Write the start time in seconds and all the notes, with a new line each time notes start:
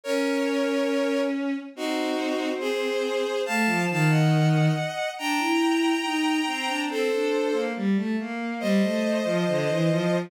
0.04 C#4 A#4 C#5
1.75 C4 D#4 F#4
2.60 G#4 C5
3.46 A3 F5 A5
3.66 F3
3.90 D#3 F5 A5
4.10 D#5 F#5
5.18 D4 G5 A#5
5.39 E4
6.04 D#4
6.47 C4
6.67 D4
6.88 C4 A4 C5
7.11 D4
7.52 A#3
7.76 G3
7.96 A3
8.19 A#3
8.60 G3 C5 D#5
8.81 A3
9.24 F3
9.48 D3
9.69 E3
9.90 F3